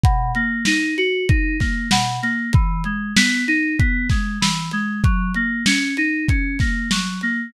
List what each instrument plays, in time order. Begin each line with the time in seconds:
0.04 electric piano 2 B2, kick, closed hi-hat
0.35 electric piano 2 A#3, closed hi-hat
0.65 electric piano 2 D#4, snare
0.97 electric piano 2 F#4, closed hi-hat
1.29 electric piano 2 D#4, kick, closed hi-hat
1.60 electric piano 2 A#3, kick, snare, closed hi-hat
1.91 electric piano 2 B2, snare
2.22 electric piano 2 A#3, closed hi-hat
2.53 electric piano 2 E3, kick, closed hi-hat
2.84 electric piano 2 G#3, closed hi-hat
3.16 electric piano 2 B3, snare
3.48 electric piano 2 D#4, closed hi-hat
3.79 electric piano 2 B3, kick, closed hi-hat
4.09 electric piano 2 G#3, kick, snare, closed hi-hat
4.41 electric piano 2 E3, snare
4.71 electric piano 2 G#3, closed hi-hat
5.04 electric piano 2 F#3, kick, closed hi-hat
5.34 electric piano 2 A#3, closed hi-hat
5.66 electric piano 2 C#4, snare
5.97 electric piano 2 D#4, closed hi-hat
6.28 electric piano 2 C#4, kick, closed hi-hat
6.59 electric piano 2 A#3, kick, snare, closed hi-hat
6.91 electric piano 2 F#3, snare
7.21 electric piano 2 A#3, closed hi-hat